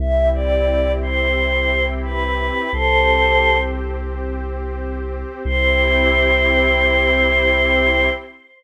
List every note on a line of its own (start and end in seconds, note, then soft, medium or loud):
0.00 2.50 C2 loud
0.00 2.71 C4 medium
0.00 2.71 E4 medium
0.00 2.71 G4 medium
0.00 0.29 E5 medium
0.34 0.92 D5 medium
1.02 1.86 C5 medium
2.05 2.71 B4 medium
2.73 5.24 C2 medium
2.73 5.43 C4 medium
2.73 5.43 G4 medium
2.73 3.58 A4 medium
2.73 3.58 C5 loud
2.73 5.43 C5 medium
5.45 8.09 C2 loud
5.45 8.09 C4 loud
5.45 8.09 E4 loud
5.45 8.09 G4 medium
5.45 8.09 C5 loud